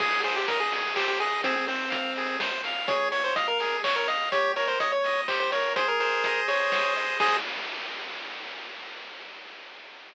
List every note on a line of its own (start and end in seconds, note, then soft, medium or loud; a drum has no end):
0.00 0.45 G#1 loud
0.00 0.21 G#4 loud
0.00 0.21 G#4 medium
0.00 kick loud
0.00 crash loud
0.24 0.35 G#4 medium
0.24 0.45 C5 medium
0.24 open hi-hat medium
0.36 0.48 G4 medium
0.46 1.35 G#1 loud
0.46 0.59 A#4 medium
0.46 0.71 D#5 medium
0.46 kick medium
0.46 closed hi-hat loud
0.60 0.94 G#4 medium
0.72 0.95 G#4 medium
0.72 open hi-hat medium
0.96 1.07 G4 medium
0.96 1.18 C5 medium
0.96 kick medium
0.96 clap loud
1.08 1.19 G4 medium
1.20 1.42 G#4 medium
1.20 1.42 D#5 medium
1.20 open hi-hat medium
1.42 1.87 F2 loud
1.42 1.55 C4 medium
1.42 1.66 G#4 loud
1.42 kick loud
1.42 closed hi-hat loud
1.56 1.67 C4 medium
1.67 2.37 C4 medium
1.67 1.89 C5 medium
1.67 open hi-hat medium
1.90 2.80 F2 loud
1.90 2.12 F5 medium
1.90 kick loud
1.90 closed hi-hat loud
2.16 2.39 G#4 medium
2.16 open hi-hat medium
2.40 2.62 C5 medium
2.40 kick medium
2.40 snare loud
2.64 2.87 F5 medium
2.64 open hi-hat medium
2.87 3.33 F2 loud
2.87 3.09 G#4 loud
2.87 3.08 C#5 medium
2.87 kick loud
2.87 closed hi-hat loud
3.12 3.23 C#5 medium
3.12 3.33 C#5 medium
3.12 open hi-hat medium
3.24 3.35 C5 medium
3.36 4.24 F2 loud
3.36 3.47 D#5 medium
3.36 3.58 F5 medium
3.36 kick medium
3.36 closed hi-hat loud
3.48 3.77 A#4 medium
3.60 3.82 G#4 medium
3.60 open hi-hat medium
3.84 3.96 C#5 medium
3.84 4.07 C#5 medium
3.84 kick medium
3.84 clap loud
3.96 4.07 A#4 medium
4.08 4.29 D#5 medium
4.08 4.29 F5 medium
4.08 open hi-hat medium
4.32 4.76 D#2 loud
4.32 4.53 G4 loud
4.32 4.52 C#5 medium
4.32 kick loud
4.32 closed hi-hat loud
4.56 4.78 A#4 medium
4.56 4.68 C#5 medium
4.56 open hi-hat medium
4.68 4.79 C5 medium
4.79 5.68 D#2 loud
4.79 5.01 C#5 medium
4.79 4.92 D#5 medium
4.79 kick medium
4.79 closed hi-hat loud
4.92 5.21 C#5 medium
5.04 5.27 D#5 medium
5.04 open hi-hat medium
5.28 5.50 G4 medium
5.28 5.39 C5 medium
5.28 kick medium
5.28 clap loud
5.40 5.51 C5 medium
5.52 5.74 A#4 medium
5.52 5.73 C#5 medium
5.52 open hi-hat medium
5.75 6.20 G#1 loud
5.75 6.48 G#4 loud
5.75 5.88 C5 medium
5.75 kick loud
5.75 closed hi-hat loud
5.88 6.00 A#4 medium
6.00 6.41 A#4 medium
6.00 6.72 C5 medium
6.00 open hi-hat medium
6.23 7.11 G#1 loud
6.23 6.96 D#5 medium
6.23 kick medium
6.23 closed hi-hat loud
6.48 7.17 G#4 medium
6.48 6.94 C#5 medium
6.48 open hi-hat medium
6.72 7.18 C5 loud
6.72 kick medium
6.72 snare loud
6.96 7.19 D#5 medium
6.96 open hi-hat medium
7.20 7.38 G#2 loud
7.20 7.37 G#4 loud
7.20 7.37 C5 medium
7.20 7.37 D#5 medium
7.20 kick loud
7.20 crash loud